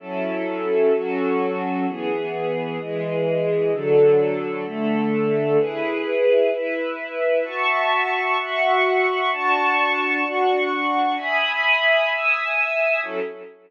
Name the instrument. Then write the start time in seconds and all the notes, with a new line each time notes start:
string ensemble 1
0.00 F#3 C#4 E4 A4
0.93 F#3 C#4 F#4 A4
1.86 E3 B3 G#4
2.79 E3 G#3 G#4
3.72 D3 F#3 A4
4.65 D3 A3 A4
5.58 E4 G#4 B4
6.51 E4 B4 E5
7.44 F#4 E5 A5 C#6
8.37 F#4 E5 F#5 C#6
9.31 D4 F#4 A5 C#6
10.23 D4 F#4 F#5 C#6
11.17 E5 G#5 B5 D#6
12.09 E5 G#5 D#6 E6
13.03 F#3 C#4 E4 A4